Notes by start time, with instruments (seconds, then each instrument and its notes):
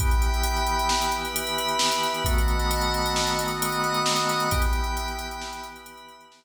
0.00 drawbar organ E3 B3 G4, pad 5 (bowed) E5 G5 B5, kick, closed hi-hat
0.11 closed hi-hat
0.22 closed hi-hat
0.34 closed hi-hat
0.43 closed hi-hat
0.57 closed hi-hat
0.67 closed hi-hat
0.79 closed hi-hat
0.89 snare
1.02 closed hi-hat
1.12 pad 5 (bowed) B4 E5 B5, closed hi-hat
1.25 closed hi-hat
1.36 closed hi-hat
1.47 closed hi-hat
1.58 closed hi-hat
1.69 closed hi-hat
1.79 snare
1.92 closed hi-hat
2.03 closed hi-hat
2.14 closed hi-hat
2.25 drawbar organ D#3 A3 B3 F#4, pad 5 (bowed) D#5 F#5 A5 B5, kick, closed hi-hat
2.38 closed hi-hat
2.48 closed hi-hat
2.59 closed hi-hat
2.71 closed hi-hat
2.81 closed hi-hat
2.94 closed hi-hat
3.06 closed hi-hat
3.16 snare
3.27 closed hi-hat
3.39 pad 5 (bowed) D#5 F#5 B5 D#6, closed hi-hat
3.48 closed hi-hat
3.62 closed hi-hat
3.72 closed hi-hat
3.84 closed hi-hat
3.94 closed hi-hat
4.06 snare
4.16 closed hi-hat
4.29 closed hi-hat
4.40 closed hi-hat
4.51 drawbar organ E3 B3 G4, pad 5 (bowed) E5 G5 B5, kick, closed hi-hat
4.62 closed hi-hat
4.73 closed hi-hat
4.84 closed hi-hat
4.97 closed hi-hat
5.08 closed hi-hat
5.19 closed hi-hat
5.31 closed hi-hat
5.42 snare
5.53 closed hi-hat
5.64 pad 5 (bowed) B4 E5 B5, closed hi-hat
5.76 closed hi-hat
5.86 closed hi-hat
5.97 closed hi-hat
6.09 closed hi-hat
6.21 closed hi-hat
6.32 snare
6.43 closed hi-hat